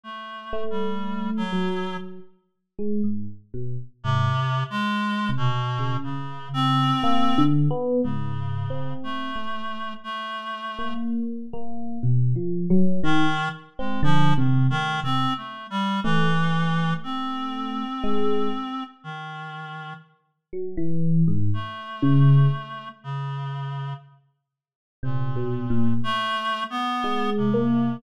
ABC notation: X:1
M:4/4
L:1/16
Q:1/4=60
K:none
V:1 name="Electric Piano 1"
z2 A,4 ^F,3 z2 ^G, ^G,, z B,, z | ^G,, z4 C, z ^C,5 (3^A,2 D,2 B,2 | (3^G,,4 C4 A,4 z3 ^A,3 A,2 | (3B,,2 F,2 ^F,2 ^D, z2 C (3=D,2 C,2 A,2 C, z3 |
A,8 ^G,2 z6 | z2 ^F, E,2 ^G,, z2 ^C,2 z6 | z4 (3C,2 B,,2 ^A,,2 z4 ^G,2 ^A,2 |]
V:2 name="Clarinet"
(3A,4 G,4 ^F,4 z8 | (3C,4 ^G,4 B,,4 ^C,2 =C4 z2 | ^C,4 A,4 A,4 z4 | z4 ^D,2 z ^G, (3F,2 D,2 D,2 (3C2 A,2 =G,2 |
E,4 C8 ^D,4 | z6 A,6 ^C,4 | z4 ^A,,4 (3=A,4 B,4 C,4 |]